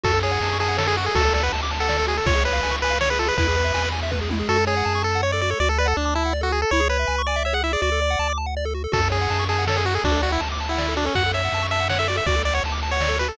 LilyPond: <<
  \new Staff \with { instrumentName = "Lead 1 (square)" } { \time 3/4 \key fis \minor \tempo 4 = 162 a'8 gis'4 gis'8 a'16 gis'16 fis'16 gis'16 | a'8 a'16 b'16 r8. a'8. gis'16 a'16 | cis''8 b'4 b'8 cis''16 b'16 a'16 b'16 | b'4. r4. |
a'8 gis'4 a'8 cis''16 d''16 d''16 cis''16 | d''16 a'16 b'16 a'16 d'8 e'8 r16 fis'16 gis'16 a'16 | cis''8 b'4 d''8 e''16 fis''16 e''16 d''16 | d''4. r4. |
a'8 gis'4 gis'8 a'16 gis'16 fis'16 gis'16 | d'8 fis'16 e'16 r8. e'8. d'16 cis'16 | fis''8 e''4 e''8 fis''16 e''16 d''16 e''16 | d''8 d''16 cis''16 r8. cis''8. b'16 a'16 | }
  \new Staff \with { instrumentName = "Lead 1 (square)" } { \time 3/4 \key fis \minor fis'16 a'16 cis''16 fis''16 a''16 cis'''16 a''16 fis''16 cis''16 a'16 fis'16 a'16 | fis'16 a'16 d''16 fis''16 a''16 d'''16 a''16 fis''16 d''16 a'16 fis'16 a'16 | eis'16 gis'16 cis''16 eis''16 gis''16 cis'''16 gis''16 eis''16 cis''16 gis'16 eis'16 gis'16 | e'16 gis'16 b'16 e''16 gis''16 b''16 gis''16 e''16 b'16 gis'16 e'16 gis'16 |
fis'16 a'16 cis''16 fis''16 a''16 cis'''16 a''16 fis''16 cis''16 a'16 fis'16 a'16 | fis'16 a'16 d''16 fis''16 a''16 d'''16 a''16 fis''16 d''16 a'16 fis'16 a'16 | e'16 gis'16 cis''16 e''16 gis''16 cis'''16 gis''16 e''16 cis''16 gis'16 e'16 gis'16 | fis'16 a'16 d''16 fis''16 a''16 d'''16 a''16 fis''16 d''16 a'16 fis'16 a'16 |
fis'16 a'16 cis''16 fis''16 a''16 cis'''16 a''16 fis''16 cis''16 a'16 fis'16 a'16 | fis'16 a'16 d''16 fis''16 a''16 d'''16 a''16 fis''16 d''16 a'16 fis'16 a'16 | fis'16 a'16 cis''16 fis''16 a''16 cis'''16 a''16 fis''16 cis''16 a'16 fis'16 a'16 | fis'16 a'16 d''16 fis''16 a''16 d'''16 a''16 fis''16 d''16 a'16 fis'16 a'16 | }
  \new Staff \with { instrumentName = "Synth Bass 1" } { \clef bass \time 3/4 \key fis \minor fis,4 fis,2 | d,4 d,2 | cis,4 cis,2 | e,4 e,2 |
fis,4 fis,2 | d,4 d,2 | cis,4 cis,2 | d,4 d,2 |
fis,4 fis,2 | d,4 d,2 | fis,4 fis,2 | d,4 d,2 | }
  \new DrumStaff \with { instrumentName = "Drums" } \drummode { \time 3/4 <cymc bd>8 cymr8 cymr8 cymr8 sn8 cymr8 | <bd cymr>8 cymr8 cymr8 cymr8 sn8 cymr8 | <bd cymr>8 cymr8 cymr8 cymr8 sn8 cymr8 | <bd cymr>8 cymr8 cymr8 cymr8 <bd tommh>8 tommh8 |
r4 r4 r4 | r4 r4 r4 | r4 r4 r4 | r4 r4 r4 |
<cymc bd>8 cymr8 cymr8 cymr8 sn8 cymr8 | <bd cymr>8 cymr8 cymr8 cymr8 sn8 cymr8 | <bd cymr>8 cymr8 cymr8 cymr8 sn8 cymr8 | <bd cymr>8 cymr8 cymr8 cymr8 sn8 cymr8 | }
>>